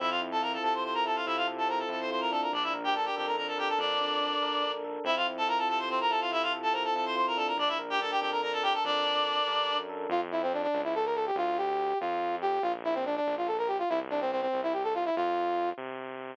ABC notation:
X:1
M:6/8
L:1/16
Q:3/8=95
K:F
V:1 name="Clarinet"
[Ee] [Ff] z [Aa] [Bb] [Aa] [Aa] [cc'] [cc'] [Bb] [Aa] [Ff] | [Ee] [Ff] z [Aa] [Bb] [Aa] [Aa] [cc'] [cc'] [Bb] [Aa] [Bb] | [Dd] [Ee] z [Gg] [Aa] [Gg] [Gg] [Bb] [Bb] [Aa] [Gg] [Aa] | [Dd]10 z2 |
[Ee] [Ff] z [Aa] [Bb] [Aa] [Aa] [cc'] [Cc] [Bb] [Aa] [Ff] | [Ee] [Ff] z [Aa] [Bb] [Aa] [Aa] [cc'] [cc'] [Bb] [Aa] [Bb] | [Dd] [Ee] z [Gg] [Aa] [Gg] [Gg] [Bb] [Bb] [Aa] [Gg] [Aa] | [Dd]10 z2 |
z12 | z12 | z12 | z12 |
z12 |]
V:2 name="Brass Section"
z12 | z12 | z12 | z12 |
z12 | z12 | z12 | z12 |
F z E C D D2 E A B A G | F2 G4 F4 G2 | F z E C D D2 F A B G F | E z D C C C2 E G A F E |
F6 z6 |]
V:3 name="Electric Piano 1"
C2 E2 F2 A2 C2 E2 | F2 A2 C2 E2 F2 D2- | D2 B2 D2 A2 D2 B2 | A2 D2 D2 B2 D2 A2 |
C2 E2 F2 A2 C2 E2 | F2 A2 C2 E2 F2 D2- | D2 B2 D2 A2 D2 B2 | A2 D2 D2 B2 D2 A2 |
z12 | z12 | z12 | z12 |
z12 |]
V:4 name="Synth Bass 1" clef=bass
F,,6 C,6 | C,6 F,,6 | B,,,6 F,,6 | F,,6 B,,,6 |
F,,6 C,6 | C,6 F,,6 | B,,,6 F,,6 | F,,6 G,,3 _G,,3 |
F,,6 ^C,,6 | D,,6 F,,6 | B,,,6 B,,,6 | C,,6 C,,6 |
F,,6 C,6 |]